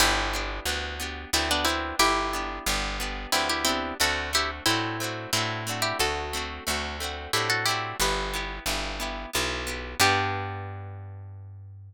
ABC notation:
X:1
M:3/4
L:1/16
Q:1/4=90
K:G
V:1 name="Pizzicato Strings"
[EG]8 [CE] [B,D] [CE]2 | [EG]8 [CE] [EG] [CE]2 | [FA]2 [EG] z [CE]4 [CE]3 [EG] | [FA]8 [EG] [FA] [EG]2 |
[GB]4 z8 | G12 |]
V:2 name="Orchestral Harp"
[B,DG]2 [B,DG]2 [B,DG]2 [B,DG]2 [B,DG]2 [B,DG]2- | [B,DG]2 [B,DG]2 [B,DG]2 [B,DG]2 [B,DG]2 [B,DG]2 | [A,CDF]2 [A,CDF]2 [A,CDF]2 [A,CDF]2 [A,CDF]2 [A,CDF]2- | [A,CDF]2 [A,CDF]2 [A,CDF]2 [A,CDF]2 [A,CDF]2 [A,CDF]2 |
[B,EG]2 [B,EG]2 [B,EG]2 [B,EG]2 [B,EG]2 [B,EG]2 | [B,DG]12 |]
V:3 name="Electric Bass (finger)" clef=bass
G,,,4 D,,4 D,,4 | G,,,4 G,,,4 D,,4 | D,,4 A,,4 A,,4 | D,,4 D,,4 A,,4 |
G,,,4 G,,,4 B,,,4 | G,,12 |]